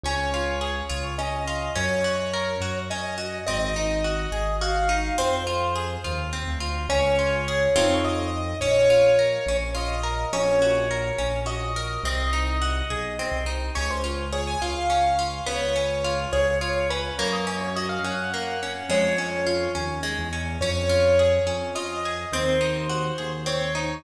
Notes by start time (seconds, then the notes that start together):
0.03 C#2 C#4 C#5
0.34 F4
0.61 G#4
0.90 C#2 F4
1.18 C#4 D#5
1.48 F4
1.75 F#2 C#4 C#5
2.04 F#4
2.34 A#4
2.61 F#2 F#4
2.90 C#4 D#5
3.18 F#4
3.47 G#1 C4 D#5
3.76 D#4
4.04 F#4
4.32 G#1 G#4
4.61 F#4 F5
4.89 D#4
5.18 F2 C4 C5
5.47 F4
5.76 G#4
6.04 D#2 F4
6.33 C4
6.48 D2
6.60 F4
6.89 C#2 C#4 C#5
7.19 F4
7.48 G#4
7.75 F2 C4 D#4 F4 A4
8.04 D#5
8.60 A#1 C#4 C#5
8.90 F4
9.19 A#4
9.46 A#1 C#4
9.75 F4 D#5
10.03 A#4
10.33 A#1 C#4 C#5
10.62 F#4
10.91 A#4
11.18 A#1 C#4
11.46 F#4 D#5
11.76 A#4
12.03 C2 C4 D#5
12.33 D#4
12.62 F#4
12.90 B1 G#4
13.19 C4
13.32 C2
13.46 D#4
13.75 C#2 C#4 C#5
13.91 C5
14.04 F4
14.33 G#4 C#5
14.47 G#5
14.62 C#2 F4 F5
14.90 C#4
15.19 F4
15.46 C#2 B3 C#5
15.76 C#4
16.04 F4
16.33 C#2 G#4 C#5
16.61 F4 C#5
16.90 C#4 B4
17.19 F#2 A#3 C#5
17.33 D#5
17.47 C#4 C#5
17.61 C#5
17.76 F#4 D#5
17.89 F5
18.04 F#2 C#4 F#5
18.34 A#3
18.63 C#4
18.89 F2 G#3 C#5
19.18 C#4
19.47 F4
19.75 D#2 C#4
20.03 G#3
20.19 E2
20.33 C#4
20.61 F2 C#4 C#5
20.89 F4
21.19 G#4
21.47 F2 C#4
21.75 F4 D#5
22.05 G#4
22.32 D#2 C4 C5
22.61 D#4
22.90 F#4
23.18 D#2 G#4
23.46 C4 C#5
23.75 D#4